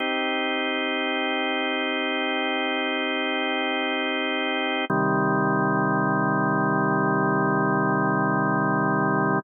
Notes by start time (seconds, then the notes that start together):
0.00 C4 D#4 G4
4.90 C3 D#3 G3